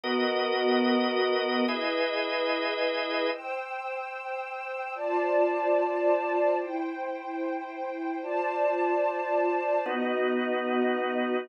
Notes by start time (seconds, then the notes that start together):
0.03 B3 F#4 A#4 D#5
1.67 E4 G#4 B4 D#5
3.31 C5 G5 E6
4.95 F4 C5 D5 A5
6.58 E4 C5 G5
8.22 F4 C5 D5 A5
9.86 B3 D#4 F#4 D#5